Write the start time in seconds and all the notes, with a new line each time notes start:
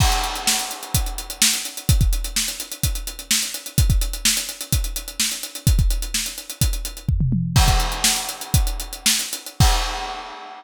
0.00 kick, crash
0.12 closed hi-hat
0.24 closed hi-hat
0.36 closed hi-hat
0.47 snare
0.59 closed hi-hat
0.71 closed hi-hat
0.83 closed hi-hat
0.94 kick, closed hi-hat
1.06 closed hi-hat
1.18 closed hi-hat
1.30 closed hi-hat
1.42 snare
1.53 closed hi-hat
1.65 closed hi-hat
1.77 closed hi-hat
1.89 kick, closed hi-hat
2.01 kick, closed hi-hat
2.13 closed hi-hat
2.24 closed hi-hat
2.36 snare
2.48 closed hi-hat
2.60 closed hi-hat
2.72 closed hi-hat
2.83 kick, closed hi-hat
2.95 closed hi-hat
3.07 closed hi-hat
3.19 closed hi-hat
3.31 snare
3.43 closed hi-hat
3.54 closed hi-hat
3.66 closed hi-hat
3.78 kick, closed hi-hat
3.90 kick, closed hi-hat
4.01 closed hi-hat
4.13 closed hi-hat
4.25 snare
4.37 closed hi-hat
4.49 closed hi-hat
4.61 closed hi-hat
4.72 kick, closed hi-hat
4.84 closed hi-hat
4.96 closed hi-hat
5.08 closed hi-hat
5.20 snare
5.31 closed hi-hat
5.43 closed hi-hat
5.55 closed hi-hat
5.67 kick, closed hi-hat
5.79 kick, closed hi-hat
5.90 closed hi-hat
6.02 closed hi-hat
6.14 snare
6.26 closed hi-hat
6.38 closed hi-hat
6.50 closed hi-hat
6.61 kick, closed hi-hat
6.73 closed hi-hat
6.85 closed hi-hat
6.97 closed hi-hat
7.09 kick, floor tom
7.20 mid tom
7.32 high tom
7.56 kick, crash
7.68 kick, closed hi-hat
7.80 closed hi-hat
7.92 closed hi-hat
8.04 snare
8.16 closed hi-hat
8.29 closed hi-hat
8.41 closed hi-hat
8.54 kick, closed hi-hat
8.67 closed hi-hat
8.80 closed hi-hat
8.93 closed hi-hat
9.06 snare
9.19 closed hi-hat
9.33 closed hi-hat
9.46 closed hi-hat
9.60 kick, crash